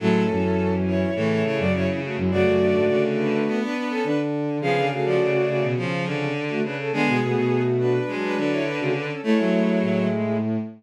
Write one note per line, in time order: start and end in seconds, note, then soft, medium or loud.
0.00 0.28 A2 loud
0.00 0.22 F#3 medium
0.00 0.30 G#3 medium
0.00 0.72 C#4 medium
0.00 0.30 E4 medium
0.00 0.72 A4 loud
0.29 1.04 F#2 loud
0.29 1.11 E3 medium
0.29 1.11 C#4 medium
0.86 1.28 E4 medium
0.86 1.28 C#5 medium
1.15 1.43 A2 loud
1.15 1.66 C#3 medium
1.15 1.42 E3 medium
1.15 1.66 A3 medium
1.30 1.43 E4 medium
1.30 1.43 C#5 medium
1.43 2.17 C#3 medium
1.43 1.58 E4 medium
1.43 1.58 C#5 medium
1.58 1.72 F#2 loud
1.58 1.73 F#4 medium
1.58 1.73 D5 medium
1.73 1.87 F#2 loud
1.73 1.87 E4 medium
1.73 1.87 C#5 medium
1.87 2.00 E3 medium
1.87 2.00 C#4 medium
2.03 2.16 A3 medium
2.03 2.16 F#4 medium
2.17 2.30 F#2 loud
2.17 2.32 G#3 medium
2.17 2.32 E4 medium
2.31 2.45 F#2 loud
2.31 2.56 C#3 medium
2.31 3.63 A3 medium
2.31 3.01 F#4 medium
2.31 3.63 F#4 medium
2.31 3.01 D5 loud
2.45 2.72 F#2 loud
2.60 2.86 D3 medium
2.74 2.88 G#2 medium
2.88 3.28 C#3 loud
2.88 3.44 D3 medium
3.18 3.56 D4 medium
3.18 3.56 B4 medium
3.46 4.01 B3 medium
3.61 3.74 D4 medium
3.61 3.74 B4 medium
3.75 3.89 D4 medium
3.75 3.89 B4 medium
3.90 4.03 C#4 medium
3.90 4.03 A4 medium
4.04 4.58 D3 loud
4.04 4.18 D4 medium
4.04 4.18 B4 medium
4.61 5.39 C#3 loud
4.61 4.75 F3 medium
4.61 4.85 B3 medium
4.61 4.85 G#4 medium
4.61 4.88 G#4 medium
4.61 4.88 F5 loud
4.76 4.90 D3 medium
4.90 5.65 A3 medium
4.90 5.65 F#4 medium
4.90 5.05 G#4 medium
4.90 5.05 F5 medium
5.05 5.20 F3 medium
5.05 5.65 F#4 medium
5.05 5.65 D5 medium
5.19 5.33 C#3 medium
5.34 5.73 C#3 medium
5.48 5.62 C#3 loud
5.63 5.76 B2 loud
5.77 6.31 C#3 medium
5.77 6.25 F3 medium
5.77 6.05 F3 medium
5.77 6.25 C#4 medium
6.06 6.58 D3 medium
6.48 6.62 A3 medium
6.48 6.62 F#4 medium
6.62 6.90 C#3 medium
6.62 6.76 D4 medium
6.62 6.76 B4 medium
6.78 6.91 C#4 medium
6.78 6.91 A4 medium
6.91 7.06 D3 loud
6.91 7.17 G#3 medium
6.91 7.16 B3 medium
6.91 7.62 B3 medium
6.91 7.16 G#4 medium
6.91 7.62 G#4 loud
7.07 7.20 B2 loud
7.21 7.35 B2 loud
7.21 7.99 A3 medium
7.21 7.99 F#4 medium
7.36 7.98 B2 loud
7.79 8.14 D4 medium
7.79 8.14 B4 medium
8.07 8.59 F#3 medium
8.07 8.35 G#3 medium
8.07 8.59 D4 medium
8.22 8.36 D4 medium
8.22 8.36 B4 medium
8.37 9.11 D3 medium
8.37 8.51 D4 medium
8.37 8.51 B4 medium
8.51 8.64 E4 medium
8.51 8.64 C#5 medium
8.65 8.79 D4 medium
8.65 8.79 B4 medium
8.78 8.94 C#3 loud
8.78 8.92 A3 medium
8.78 8.92 F#4 medium
8.93 9.07 D4 medium
8.93 9.07 B4 medium
9.08 9.21 C#4 medium
9.08 9.21 A4 medium
9.23 10.37 G#3 medium
9.23 9.37 A3 loud
9.23 9.37 A3 medium
9.23 10.04 E4 medium
9.23 10.37 E4 medium
9.23 10.04 C#5 loud
9.37 10.07 F#3 medium
9.37 9.51 A3 loud
9.52 9.78 A3 loud
9.81 10.57 A2 loud